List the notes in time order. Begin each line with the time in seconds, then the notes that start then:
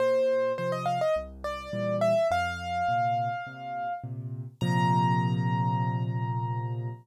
0.00 A#2 C5
0.58 C3 F3 C5
0.72 D#5
0.86 F5
1.01 D#5
1.16 C2
1.44 D5
1.73 A#2 E3 G3
2.01 E5
2.31 F2 F5
2.88 A#2 C3
3.47 A#2 C3
4.04 A#2 C3
4.61 A#2 C3 F3 A#5